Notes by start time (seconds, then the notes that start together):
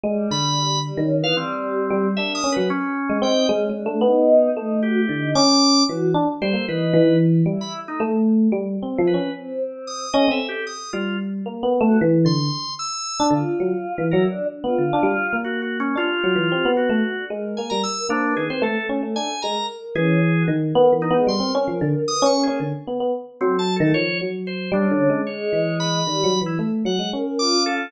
0.04 G3 G#3
0.31 D3 B5
0.84 G3
0.97 D#3 C#4
1.19 B3
1.23 E3 F5
1.35 G3 C4
1.90 G3
2.17 A#3 D4 E5
2.35 D#6
2.44 C#4
2.52 B4
2.57 F#3
2.70 C#4
3.10 G#3
3.22 C4 D#4 G5
3.49 G#3 C#4
3.69 G#3
3.75 D4
3.86 A3
4.01 B3 D#4
4.56 A3 D#4
4.83 F#4 G4
4.99 E4
5.09 D3
5.17 D#4
5.35 C#4 D6
5.89 E3 F#4
6.14 D4
6.41 G3 A4 C5
6.53 A#3
6.68 E3 D#4 B4
6.94 E3
7.46 G3 E4
7.61 E4 B5
7.83 A3
7.88 D#4
8.00 A3
8.52 G3
8.83 C4
8.94 E4
8.98 F3
9.07 B4
9.14 C#4
9.35 C4
9.87 D#6
10.13 C#4 A4 D#5
10.28 C4 E5
10.49 G4
10.67 D#6
10.93 G3 F4
11.46 A#3
11.63 B3
11.81 A3
11.86 F#4
12.01 E3
12.25 D3 C6
12.79 E6
13.20 D4
13.31 D3 F4
13.60 F#3
13.98 E3
14.11 F#3 E4 A#4
14.29 D4
14.49 D4
14.64 B3 F4
14.78 D3
14.93 D4
15.03 G3
15.33 A#3
15.44 F#4
15.62 F#4
15.80 C#4
15.96 D4 F4 G4
16.24 F#3
16.36 E3
16.52 C4
16.65 B3
16.77 F#4
16.89 A3
17.04 F#4
17.17 D4
17.30 G#3 A#4
17.57 A#3 G#5
17.70 G3 A#5
17.84 E6
18.08 A#3 C4 D4
18.27 B3
18.36 D#3 G#4
18.45 B4
18.50 C4 C5
18.61 A3 A4
18.89 C#4
19.03 A3
19.16 D4 G#5
19.42 G#3 A#4 A#5
19.95 E3 C#4 G#4
20.37 F#4
20.48 D#3
20.75 B3 A#4
20.92 E3 B3
21.02 D#4
21.10 G#3 B3
21.27 G3 A#4 C6
21.40 C4
21.55 C#4
21.68 F3
21.81 D3
22.07 B4 D#6
22.22 C#4 C#6
22.35 A#3
22.43 G#4
22.48 C#4
22.60 D3
22.87 B3
23.00 B3
23.41 F#3 C4 A4
23.59 A5
23.76 A3 A4
23.80 D#3
23.94 F3 C#5
24.21 F#3
24.47 C5
24.72 G3 C#4 D4
24.91 D3
25.10 G#3
25.27 G#3 C#5
25.53 E3
25.80 B5
26.07 D#3 G3
26.24 F#3
26.41 E3
26.46 E4
26.59 A3
26.85 F#3 F#5
26.99 G#3
27.13 C#4 A#4
27.39 F4 D6
27.66 A4